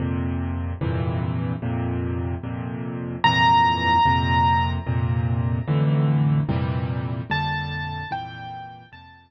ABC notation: X:1
M:6/8
L:1/8
Q:3/8=74
K:F
V:1 name="Acoustic Grand Piano"
z6 | z6 | b6 | z6 |
z3 a3 | g3 a3 |]
V:2 name="Acoustic Grand Piano" clef=bass
[F,,B,,C,]3 [F,,G,,B,,C,E,]3 | [F,,B,,C,]3 [F,,B,,C,]3 | [F,,G,,B,,C,E,]3 [F,,B,,C,]3 | [F,,B,,C,]3 [F,,A,,D,E,]3 |
[F,,B,,C,E,G,]3 [F,,B,,D,G,]3 | [F,,B,,C,E,G,]3 [F,,B,,C,]3 |]